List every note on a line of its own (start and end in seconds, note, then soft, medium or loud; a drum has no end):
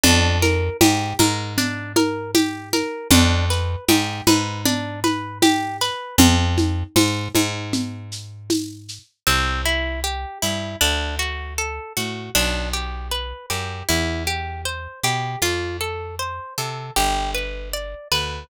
0.04 0.70 F2 loud
0.04 0.38 D4 loud
0.04 low conga loud
0.04 shaker loud
0.42 0.77 A#4 medium
0.42 high conga medium
0.42 shaker medium
0.81 1.14 G#2 loud
0.81 1.16 G4 medium
0.81 tambourine loud
0.81 high conga loud
0.81 shaker loud
1.19 2.83 G#2 loud
1.19 1.54 A#4 medium
1.19 high conga loud
1.19 shaker medium
1.58 1.93 D4 medium
1.58 low conga medium
1.58 shaker loud
1.96 2.31 A#4 medium
1.96 high conga loud
1.96 shaker medium
2.35 2.69 G4 medium
2.35 tambourine medium
2.35 high conga loud
2.35 shaker medium
2.73 3.08 A#4 medium
2.73 high conga medium
2.73 shaker medium
3.11 3.76 F2 loud
3.11 3.46 D4 loud
3.11 low conga loud
3.11 shaker loud
3.50 3.85 B4 medium
3.50 shaker medium
3.88 4.21 G#2 loud
3.88 4.23 G4 medium
3.88 tambourine loud
3.88 high conga loud
3.88 shaker medium
4.27 5.90 G#2 loud
4.27 4.62 B4 medium
4.27 high conga loud
4.27 shaker medium
4.65 5.00 D4 medium
4.65 low conga loud
4.65 shaker loud
5.04 5.38 B4 medium
5.04 high conga medium
5.04 shaker medium
5.42 5.77 G4 medium
5.42 tambourine loud
5.42 high conga loud
5.42 shaker loud
5.81 6.16 B4 medium
5.81 shaker medium
6.18 6.84 F2 loud
6.18 low conga loud
6.18 shaker loud
6.58 high conga medium
6.58 shaker medium
6.96 7.29 G#2 loud
6.96 tambourine loud
6.96 high conga loud
6.96 shaker loud
7.35 8.99 G#2 loud
7.35 high conga medium
7.35 shaker medium
7.73 low conga loud
7.73 shaker loud
8.12 shaker medium
8.50 tambourine loud
8.50 high conga medium
8.50 shaker medium
8.88 shaker medium
9.27 10.25 C2 medium
9.27 9.61 C4 medium
9.66 10.00 E4 medium
10.04 10.38 G4 medium
10.42 10.76 G2 medium
10.42 10.77 E4 medium
10.81 11.80 D2 medium
10.81 11.16 D4 loud
11.19 11.54 F#4 medium
11.58 11.93 A4 medium
11.97 12.30 A2 medium
11.97 12.31 F#4 medium
12.35 13.33 B1 medium
12.35 12.70 D4 loud
12.73 13.08 G4 medium
13.12 13.46 B4 medium
13.50 13.83 F#2 medium
13.50 13.85 G4 medium
13.89 14.88 E2 medium
13.89 14.23 E4 medium
14.27 14.62 G4 medium
14.65 15.00 C5 medium
15.04 15.36 B2 medium
15.04 15.39 G4 medium
15.42 16.40 F2 medium
15.42 15.77 F4 loud
15.81 16.15 A4 medium
16.19 16.54 C5 medium
16.58 16.91 C3 medium
16.58 16.92 A4 medium
16.96 17.95 G1 medium
16.96 17.31 G4 medium
17.35 17.69 B4 medium
17.74 18.08 D5 medium
18.12 18.44 D2 medium
18.12 18.46 B4 medium